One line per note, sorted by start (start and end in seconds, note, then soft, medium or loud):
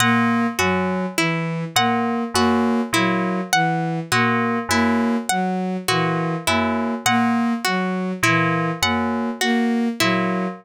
0.00 0.47 A#2 medium
0.00 0.47 A#3 medium
0.00 0.47 F#5 medium
0.59 1.06 F#2 medium
0.59 1.06 F#3 medium
0.59 1.06 F#4 medium
1.17 1.64 E3 medium
1.17 1.65 E4 medium
1.76 2.23 A#2 medium
1.76 2.24 A#3 medium
1.76 2.24 F#5 medium
2.34 2.81 F#2 medium
2.34 2.81 A#3 medium
2.34 2.83 F#4 medium
2.93 3.40 A#2 medium
2.93 3.41 F#3 medium
2.93 3.41 E4 medium
3.53 4.00 E3 medium
3.53 4.00 F#5 medium
4.12 4.59 A#2 medium
4.12 4.59 A#3 medium
4.12 4.59 F#4 medium
4.69 5.16 F#2 medium
4.69 5.17 A#3 medium
4.69 5.18 E4 medium
5.29 5.77 F#3 medium
5.29 5.76 F#5 medium
5.88 6.36 A#2 medium
5.88 6.36 E3 medium
5.88 6.35 F#4 medium
6.47 6.95 F#2 medium
6.47 6.95 A#3 medium
6.47 6.94 E4 medium
7.06 7.53 A#2 medium
7.06 7.54 A#3 medium
7.06 7.53 F#5 medium
7.64 8.13 F#3 medium
7.64 8.12 F#4 medium
8.23 8.70 A#2 medium
8.23 8.72 E3 medium
8.23 8.71 E4 medium
8.82 9.29 F#2 medium
8.82 9.30 A#3 medium
8.82 9.30 F#5 medium
9.41 9.89 A#3 medium
9.41 9.88 F#4 medium
10.00 10.48 A#2 medium
10.00 10.47 F#3 medium
10.00 10.47 E4 medium